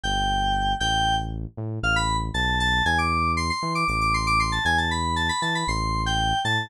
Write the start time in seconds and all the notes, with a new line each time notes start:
0.03 G1 G5
0.80 A1 G5
1.57 A2
1.83 A1 F5
1.96 B5
2.34 B1 A5
2.60 A5
2.85 E2 G#5
2.98 D6
3.37 C6
3.50 C6
3.63 E3
3.75 D6
3.88 A1 D6
4.01 D6
4.14 C6
4.27 D6
4.40 C6
4.52 A5
4.65 E2 G#5
4.78 A5
4.91 B5
5.16 A5
5.29 B5
5.42 E3 A5
5.55 B5
5.68 A1 C6
6.06 G5
6.44 A2 A5